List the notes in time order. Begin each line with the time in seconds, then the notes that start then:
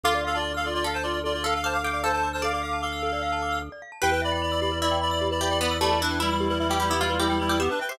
0.03 D2 F4 A4 F5 D6
0.15 D5
0.25 A4 F5
0.35 F4 D5 A5
0.44 D6
0.54 A4 F5 F6
0.64 F4 A4 D5
0.74 F4 D5
0.84 A4 F5
0.94 C5 A5
1.03 F4 D5 D6
1.14 F6
1.24 F4 A4 D5
1.34 F4 D5
1.44 A4 F5
1.54 A4 F5 A5
1.64 C5 F5 A5 D6
1.73 F5 D6 F6
1.83 A4 F5 G5 D6
1.92 D5 F5 D6
2.03 A4 C5 F5 A5
2.12 C5 A5
2.23 D6
2.33 C5 A5 F6
2.42 A4 D5 F5 D6
2.53 D5 F5 D6
2.62 F5 D6
2.73 A5
2.82 A4 F5 D6
2.93 F6
3.03 A4
3.13 D5
3.23 F5
3.32 A5
3.42 D6
3.52 F6
3.62 A4
3.72 D5
3.82 F5
3.92 A5
4.02 E2 G4 B4 G5
4.12 B4 G5
4.22 D5 E5 B5
4.32 D5 G5 B5
4.42 D5 B5
4.52 D5 B5 E6
4.61 G4 D5 B5
4.72 B4
4.81 E4 D5 E5 B5
4.91 G5
5.01 D5 B5
5.11 D5 B5 E6
5.21 G4
5.31 B4 D5 B5
5.41 G4 D5 E5 B5
5.50 D5 G5 B5
5.59 B3 D5 B5
5.71 E6
5.81 A3 G4 D5 B5
5.91 B4
6.01 D4 E4 B4 E5
6.11 G5
6.20 G3 E4 B5
6.31 G3 E4 E6
6.40 G4
6.49 G3 E4 B4
6.59 G3 E4 E5
6.68 G3 E4 G4 G5
6.80 G3 E4 G4 B5
6.90 B3 E4 G4 E6
7.00 G3 E4 F4 G4
7.10 B4
7.18 G3 E4 G4 E5
7.29 G3 E4 G5
7.40 G3 E4 B5
7.49 G3 E4 G4 E6
7.60 B3 G4 E5
7.69 D4 B4
7.80 B4 E5 G5
7.89 G4 C5 E5 G5